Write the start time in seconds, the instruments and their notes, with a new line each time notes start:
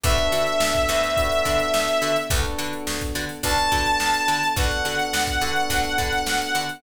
0.04 electric bass (finger) D2, electric piano 1 B3 D4 F#4 A4, pizzicato strings D4 F#4 A4 B4, lead 2 (sawtooth) E5, kick, closed hi-hat
0.18 closed hi-hat
0.32 electric bass (finger) D3, pizzicato strings D4 F#4 A4 B4, closed hi-hat
0.47 closed hi-hat
0.60 electric bass (finger) D2, snare
0.74 kick, closed hi-hat
0.88 electric bass (finger) D2, pizzicato strings D4 F#4 A4 B4, closed hi-hat
1.04 closed hi-hat
1.17 electric piano 1 B3 D4 F#4 A4, kick, closed hi-hat
1.32 snare, closed hi-hat
1.45 electric bass (finger) D3, pizzicato strings D4 F#4 A4 B4, kick, snare, closed hi-hat
1.60 closed hi-hat
1.74 electric bass (finger) D2, snare
1.88 closed hi-hat
2.02 electric bass (finger) D3, pizzicato strings D4 F#4 A4 B4, closed hi-hat
2.16 closed hi-hat
2.30 electric bass (finger) D2, electric piano 1 B3 D4 F#4 A4, pizzicato strings D4 F#4 A4 B4, kick, closed hi-hat
2.45 snare, closed hi-hat
2.58 electric bass (finger) D3, pizzicato strings D4 F#4 A4 B4, closed hi-hat
2.73 closed hi-hat
2.87 electric bass (finger) D2, snare
3.01 kick, closed hi-hat
3.15 electric bass (finger) D3, pizzicato strings D4 F#4 A4 B4, closed hi-hat
3.29 snare, closed hi-hat
3.43 electric bass (finger) D2, electric piano 1 B3 D4 F#4 A4, pizzicato strings D4 F#4 A4 B4, lead 2 (sawtooth) A5, kick, closed hi-hat
3.58 snare, closed hi-hat
3.72 electric bass (finger) D3, pizzicato strings D4 F#4 A4 B4, kick, closed hi-hat
3.86 closed hi-hat
4.00 electric bass (finger) D2, snare
4.14 closed hi-hat
4.28 electric bass (finger) D3, pizzicato strings D4 F#4 A4 B4, closed hi-hat
4.43 closed hi-hat
4.56 electric bass (finger) D2, electric piano 1 B3 D4 F#4 A4, pizzicato strings D4 F#4 A4 B4, lead 2 (sawtooth) F#5, kick, closed hi-hat
4.71 closed hi-hat
4.85 electric bass (finger) D3, pizzicato strings D4 F#4 A4 B4, snare, closed hi-hat
4.99 closed hi-hat
5.13 electric bass (finger) D2, snare
5.27 kick, closed hi-hat
5.41 electric bass (finger) D3, electric piano 1 B3 D4 F#4 A4, pizzicato strings D4 F#4 A4 B4, closed hi-hat
5.56 closed hi-hat
5.70 electric bass (finger) D2, pizzicato strings D4 F#4 A4 B4, kick, closed hi-hat
5.84 closed hi-hat
5.98 electric bass (finger) D3, pizzicato strings D4 F#4 A4 B4, kick, closed hi-hat
6.13 closed hi-hat
6.26 electric bass (finger) D2, snare
6.42 closed hi-hat
6.55 electric bass (finger) D3, pizzicato strings D4 F#4 A4 B4, closed hi-hat
6.69 closed hi-hat